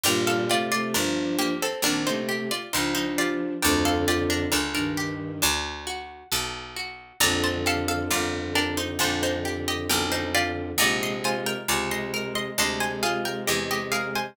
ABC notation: X:1
M:4/4
L:1/16
Q:1/4=67
K:Gm
V:1 name="Harpsichord"
[Bg] [Af] [Fd] [Fd] [DB]2 [B,G] [CA] [DB] [Ec] z [Fd] [Ec] [Ec] [Fd]2 | [Bg] [Af] [Fd] [DB] [DB] [DB]7 z4 | [db] [ca] [Af] [Af] [Fd]2 [DB] [Ec] [Ec] [Ec] z [Ge] [Bg] [Ec] [Fd]2 | [db] [ec'] [c_a] [Bg] [db] [ec']2 [ec'] [ec'] [ca] [_Af] [Bg] [Ge] [Ge] [Af] [ca] |]
V:2 name="Violin"
[B,,G,]2 [C,A,] [C,A,] [F,D]3 z [E,C] [C,A,]2 z [F,D]4 | [F,,D,]4 z [G,,E,]3 z8 | [F,,D,]4 [F,,D,]4 [F,,D,]8 | [C,_A,]4 [C,A,]4 [C,A,]8 |]
V:3 name="Acoustic Guitar (steel)"
D2 G2 B2 G2 D2 G2 B2 G2 | D2 G2 A2 G2 D2 ^F2 A2 F2 | D2 G2 B2 G2 D2 G2 B2 G2 | E2 F2 _A2 B2 D2 F2 A2 B2 |]
V:4 name="Harpsichord" clef=bass
G,,,4 G,,,4 B,,,4 _D,,4 | D,,4 _D,,4 =D,,4 =B,,,4 | B,,,4 G,,,4 B,,,4 =B,,,4 | B,,,4 _D,,4 =D,,4 =E,,4 |]